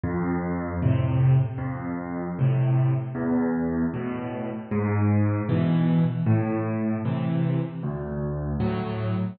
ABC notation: X:1
M:4/4
L:1/8
Q:1/4=77
K:Am
V:1 name="Acoustic Grand Piano" clef=bass
F,,2 [A,,C,]2 F,,2 [A,,C,]2 | E,,2 [A,,B,,]2 ^G,,2 [B,,E,]2 | A,,2 [C,E,]2 D,,2 [A,,^F,]2 |]